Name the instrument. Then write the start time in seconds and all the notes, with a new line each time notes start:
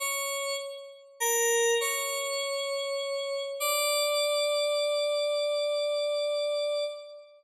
electric piano 2
0.00 C#5
1.20 A#4
1.80 C#5
3.60 D5